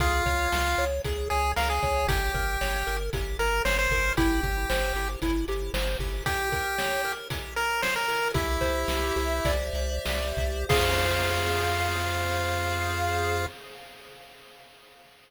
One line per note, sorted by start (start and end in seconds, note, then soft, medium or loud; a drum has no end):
0.00 0.22 C#2 loud
0.00 0.85 F4 loud
0.00 0.24 G#4 loud
0.00 kick medium
0.00 closed hi-hat medium
0.26 0.48 C#2 medium
0.26 0.49 C#5 loud
0.26 kick medium
0.26 closed hi-hat medium
0.52 0.75 C#2 loud
0.52 0.76 F5 medium
0.52 snare medium
0.78 1.00 C#2 medium
0.78 1.02 C#5 medium
0.78 closed hi-hat medium
1.04 1.28 C#2 medium
1.04 1.28 G#4 medium
1.04 kick medium
1.04 closed hi-hat medium
1.30 1.54 C#2 loud
1.30 1.52 G#4 loud
1.30 1.54 C#5 medium
1.30 closed hi-hat medium
1.56 1.79 C#2 loud
1.56 1.69 A#4 loud
1.56 1.80 F5 medium
1.56 snare medium
1.70 2.07 G#4 loud
1.82 2.06 C#2 medium
1.82 2.06 C#5 medium
1.82 kick medium
1.82 closed hi-hat medium
2.07 2.29 G1 loud
2.07 2.32 G4 loud
2.07 2.97 G4 loud
2.07 kick medium
2.07 closed hi-hat loud
2.34 2.57 G1 loud
2.34 2.58 A#4 medium
2.34 kick medium
2.34 closed hi-hat medium
2.61 2.83 G1 medium
2.61 2.84 C#5 loud
2.61 snare medium
2.87 3.10 G1 medium
2.87 3.10 A#4 medium
2.87 closed hi-hat medium
3.13 3.36 G1 medium
3.13 3.37 G4 medium
3.13 kick medium
3.13 closed hi-hat medium
3.39 3.61 G1 loud
3.39 3.62 A#4 loud
3.39 3.63 A#4 medium
3.39 closed hi-hat medium
3.65 3.87 G1 loud
3.65 3.77 C5 loud
3.65 3.88 C#5 medium
3.65 snare medium
3.79 4.13 C5 loud
3.90 4.12 G1 loud
3.90 4.15 A#4 medium
3.90 kick medium
3.90 open hi-hat medium
4.17 4.40 G1 loud
4.17 4.41 E4 loud
4.17 5.08 G4 loud
4.17 kick medium
4.17 closed hi-hat medium
4.43 4.65 G1 loud
4.43 4.67 G4 loud
4.43 kick medium
4.43 closed hi-hat medium
4.69 4.92 G1 loud
4.69 4.93 C5 medium
4.69 snare medium
4.94 5.16 G1 medium
4.94 5.19 G4 medium
4.94 closed hi-hat medium
5.22 5.45 G1 loud
5.22 5.46 E4 medium
5.22 kick medium
5.22 closed hi-hat medium
5.48 5.70 G1 medium
5.48 5.72 G4 medium
5.48 closed hi-hat medium
5.74 5.96 G1 loud
5.74 5.97 C5 medium
5.74 snare loud
5.99 6.21 G1 loud
5.99 6.24 G4 medium
5.99 kick medium
5.99 open hi-hat medium
6.26 7.12 G4 loud
6.26 6.50 G4 loud
6.26 kick medium
6.26 closed hi-hat medium
6.52 6.76 A#4 medium
6.52 kick medium
6.52 closed hi-hat medium
6.78 7.02 C#5 medium
6.78 snare medium
7.05 7.28 A#4 medium
7.05 closed hi-hat medium
7.30 7.54 G4 loud
7.30 kick medium
7.30 closed hi-hat medium
7.56 7.82 A#4 loud
7.56 7.80 A#4 medium
7.56 closed hi-hat medium
7.82 7.95 C5 loud
7.82 8.06 C#5 medium
7.82 snare medium
7.96 8.28 A#4 loud
8.08 8.32 A#4 loud
8.08 open hi-hat medium
8.34 8.58 C2 loud
8.34 9.52 E4 loud
8.34 9.15 G4 loud
8.34 kick medium
8.34 closed hi-hat medium
8.61 8.85 C2 medium
8.61 10.37 C5 medium
8.61 kick medium
8.61 closed hi-hat medium
8.88 9.12 C2 loud
8.88 9.74 E5 medium
8.88 snare medium
9.16 9.41 C2 loud
9.16 10.05 G4 medium
9.16 closed hi-hat medium
9.45 9.70 C2 loud
9.45 10.63 D5 medium
9.45 kick medium
9.45 closed hi-hat medium
9.73 9.99 C2 loud
9.73 10.65 E5 medium
9.73 closed hi-hat medium
10.05 10.33 C2 medium
10.05 10.66 G4 medium
10.05 snare loud
10.37 10.65 C2 loud
10.37 10.69 C5 medium
10.37 kick medium
10.37 closed hi-hat medium
10.69 13.47 F2 loud
10.69 13.46 F4 loud
10.69 13.45 G#4 loud
10.69 13.45 C5 medium
10.69 13.45 F5 loud
10.69 kick loud
10.69 crash loud